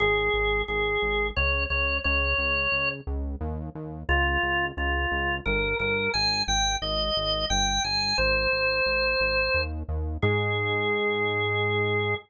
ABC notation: X:1
M:3/4
L:1/8
Q:1/4=88
K:Ab
V:1 name="Drawbar Organ"
A2 A2 d d | d3 z3 | F2 F2 B B | a g e2 g a |
c5 z | A6 |]
V:2 name="Synth Bass 1" clef=bass
A,,, A,,, A,,, A,,, D,, D,, | D,, D,, D,, D,, E,, E,, | D,, D,, D,, D,, G,,, G,,, | A,,, A,,, A,,, A,,, G,,, G,,, |
A,,, A,,, A,,, A,,, E,, E,, | A,,6 |]